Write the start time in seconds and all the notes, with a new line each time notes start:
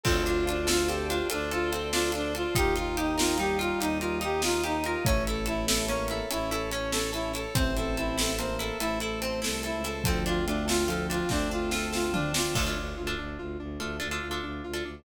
0.04 D2 C4 F4 A4 C5 D5 F5 A5, kick, crash
0.26 D4 F4, closed hi-hat
0.47 D4 F4, closed hi-hat
0.67 F4 A4, snare
0.88 C4 G4 A4, closed hi-hat
1.09 D4 F4, closed hi-hat
1.30 D2 D4 F4 A4 C5 D5 A5 C6, closed hi-hat
1.51 F4 A4, closed hi-hat
1.71 C4 A4, closed hi-hat
1.92 D4 F4, snare
2.12 D4 F4, closed hi-hat
2.35 F4 A4, closed hi-hat
2.55 D#2 D#4 F4 G4 D#5 F5 G5 A#5, kick, closed hi-hat
2.76 F4, closed hi-hat
2.97 D#4 G4, closed hi-hat
3.18 D#4 F4 A#4, snare
3.38 G3 D#4 G4, closed hi-hat
3.59 F4, closed hi-hat
3.79 D#2 D#4 G4 D#5 F5 A#5 D#6, closed hi-hat
4.00 F4 A#4, closed hi-hat
4.21 D#4 G4, closed hi-hat
4.42 F4, snare
4.64 D#4 G4, closed hi-hat
4.84 F4 A#4, closed hi-hat
5.05 A1 A3 C#4 C#5 E5 A5, kick, closed hi-hat
5.27 E4 A4, closed hi-hat
5.46 E4 A4, closed hi-hat
5.67 E4 A4, snare
5.87 A#3 C#4 C#5, closed hi-hat
6.08 E4 A4, closed hi-hat
6.30 A1 C#4 E4 A4 C#5 A5, closed hi-hat
6.51 E4 A4, closed hi-hat
6.72 C#4 C#5, closed hi-hat
6.92 E4 A4, snare
7.13 E4 A4, closed hi-hat
7.34 E4 A4, closed hi-hat
7.55 A1 C4 C5 E5 A5, kick, closed hi-hat
7.77 E4 A4, closed hi-hat
7.97 E4 A4, closed hi-hat
8.18 E4 A4, snare
8.38 A#3 C4 C5, closed hi-hat
8.59 E4 A4, closed hi-hat
8.80 A1 A3 E4 A4 C5 A5, closed hi-hat
9.00 E4 A4, closed hi-hat
9.21 C4 C5, closed hi-hat
9.42 C2 E4 A4, snare
9.63 E4 A4, closed hi-hat
9.74 C#2
9.84 E4 A4, closed hi-hat
10.04 D2 F3 C4 D4 F4 A4, kick, closed hi-hat
10.26 D4 F4, closed hi-hat
10.46 A3 D4 F4, closed hi-hat
10.68 F4 A4, snare
10.88 F3 F4 A4, closed hi-hat
11.10 D4 F4, closed hi-hat
11.29 D2 A3 C4 D4 A4 C5, kick, snare
11.51 D4 F4
11.71 F4 A4, snare
11.93 F4 A4, snare
12.13 D4 F4, floor tom
12.34 D4 F4, snare
12.55 D2 A3 D4 F4 A4, kick, crash
12.66 D4 F4 A4
12.76 D2 D4
12.97 D2 F4
13.07 D4 F4 A4
13.18 D2 D4
13.39 D2 F4
13.59 D2 D4
13.80 D2 A3 D4 F4 A4
14.00 D2 D4 F4 A4
14.11 D4 F4 A4
14.22 D2 F4
14.31 D4 F4 A4
14.43 D2 D4
14.64 D2 F4
14.74 D4 F4 A4
14.85 D2 D4